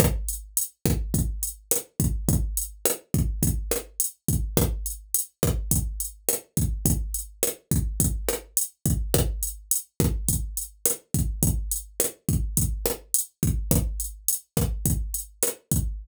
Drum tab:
HH |xxxxxxxx|xxxxxxxx|xxxxxxxx|xxxxxxxx|
SD |r--r--r-|--r--r--|r--r--r-|--r--r--|
BD |o--oo--o|o--oo--o|o--oo--o|o--oo--o|

HH |xxxxxxxx|xxxxxxxx|xxxxxxxx|
SD |r--r--r-|--r--r--|r--r--r-|
BD |o--oo--o|o--oo--o|o--oo--o|